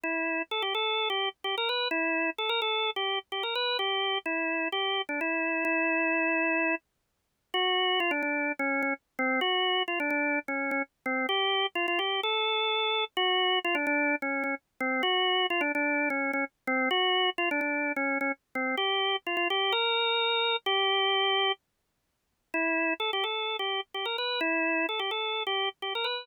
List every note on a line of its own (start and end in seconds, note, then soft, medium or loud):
0.04 0.42 E4 medium
0.51 0.62 A4 medium
0.62 0.74 G4 medium
0.75 1.08 A4 medium
1.10 1.29 G4 medium
1.44 1.55 G4 medium
1.58 1.69 A#4 medium
1.69 1.88 B4 medium
1.91 2.30 E4 medium
2.38 2.50 A4 medium
2.49 2.60 A#4 medium
2.62 2.90 A4 medium
2.96 3.19 G4 medium
3.32 3.43 G4 medium
3.43 3.54 A#4 medium
3.55 3.77 B4 medium
3.79 4.18 G4 medium
4.26 4.68 E4 medium
4.72 5.02 G4 medium
5.09 5.20 D4 medium
5.21 5.64 E4 medium
5.65 6.75 E4 medium
7.54 8.00 F#4 medium
8.00 8.11 F4 medium
8.11 8.22 D4 medium
8.23 8.52 D4 medium
8.59 8.82 C#4 medium
8.83 8.94 C#4 medium
9.19 9.40 C4 medium
9.41 9.83 F#4 medium
9.88 9.99 F4 medium
10.00 10.10 D4 medium
10.10 10.39 D4 medium
10.48 10.71 C#4 medium
10.71 10.82 C#4 medium
11.06 11.26 C4 medium
11.29 11.66 G4 medium
11.75 11.86 F4 medium
11.88 11.99 F4 medium
11.99 12.21 G4 medium
12.23 13.04 A4 medium
13.17 13.59 F#4 loud
13.64 13.76 F4 medium
13.75 13.86 D4 medium
13.87 14.15 D4 loud
14.22 14.43 C#4 medium
14.44 14.55 C#4 medium
14.80 15.02 C4 medium
15.03 15.46 F#4 loud
15.50 15.61 F4 medium
15.61 15.72 D4 medium
15.75 16.09 D4 medium
16.10 16.31 C#4 medium
16.33 16.45 C#4 medium
16.67 16.89 C4 medium
16.91 17.30 F#4 loud
17.38 17.49 F4 medium
17.51 17.60 D4 medium
17.61 17.92 D4 medium
17.96 18.18 C#4 medium
18.21 18.32 C#4 medium
18.55 18.75 C4 medium
18.77 19.16 G4 medium
19.27 19.36 F4 medium
19.37 19.48 F4 medium
19.50 19.73 G4 medium
19.72 20.56 A#4 medium
20.66 21.52 G4 loud
22.54 22.94 E4 medium
23.00 23.11 A4 medium
23.13 23.24 G4 medium
23.24 23.57 A4 medium
23.59 23.81 G4 medium
23.94 24.05 G4 medium
24.05 24.17 A#4 medium
24.18 24.40 B4 medium
24.41 24.86 E4 medium
24.89 25.00 A4 medium
24.99 25.11 G4 medium
25.11 25.43 A4 medium
25.47 25.69 G4 medium
25.82 25.93 G4 medium
25.95 26.06 A#4 medium
26.04 26.25 B4 medium